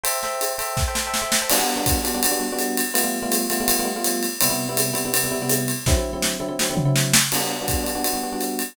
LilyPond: <<
  \new Staff \with { instrumentName = "Electric Piano 1" } { \time 4/4 \key g \major \tempo 4 = 165 <a' c'' e'' g''>8 <a' c'' e'' g''>4 <a' c'' e'' g''>8. <a' c'' e'' g''>16 <a' c'' e'' g''>16 <a' c'' e'' g''>8 <a' c'' e'' g''>8 <a' c'' e'' g''>16 | <g b d' fis'>16 <g b d' fis'>8 <g b d' fis'>8. <g b d' fis'>16 <g b d' fis'>16 <g b d' fis'>16 <g b d' fis'>16 <g b d' fis'>16 <g b d' fis'>4~ <g b d' fis'>16 | <g a b f'>16 <g a b f'>8 <g a b f'>8. <g a b f'>16 <g a b f'>16 <g a b f'>16 <g a b f'>16 <g a b f'>16 <g a b f'>4~ <g a b f'>16 | <c g b e'>16 <c g b e'>8 <c g b e'>8. <c g b e'>16 <c g b e'>16 <c g b e'>16 <c g b e'>16 <c g b e'>16 <c g b e'>4~ <c g b e'>16 |
<d fis c' e'>16 <d fis c' e'>8 <d fis c' e'>8. <d fis c' e'>16 <d fis c' e'>16 <d fis c' e'>16 <d fis c' e'>16 <d fis c' e'>16 <d fis c' e'>4~ <d fis c' e'>16 | <g b d' fis'>16 <g b d' fis'>8 <g b d' fis'>8. <g b d' fis'>16 <g b d' fis'>16 <g b d' fis'>16 <g b d' fis'>16 <g b d' fis'>16 <g b d' fis'>4~ <g b d' fis'>16 | }
  \new DrumStaff \with { instrumentName = "Drums" } \drummode { \time 4/4 cymr8 sn8 <hhp cymr>8 cymr8 <bd sn>8 sn8 sn8 sn8 | <cymc cymr>4 <hhp bd cymr>8 cymr8 cymr4 <hhp cymr>8 cymr8 | cymr4 <hhp cymr>8 cymr8 cymr4 <hhp cymr>8 cymr8 | cymr4 <hhp cymr>8 cymr8 cymr4 <hhp cymr>8 cymr8 |
<bd sn>4 sn4 sn8 tomfh8 sn8 sn8 | <cymc cymr>4 <hhp bd cymr>8 cymr8 cymr4 <hhp cymr>8 cymr8 | }
>>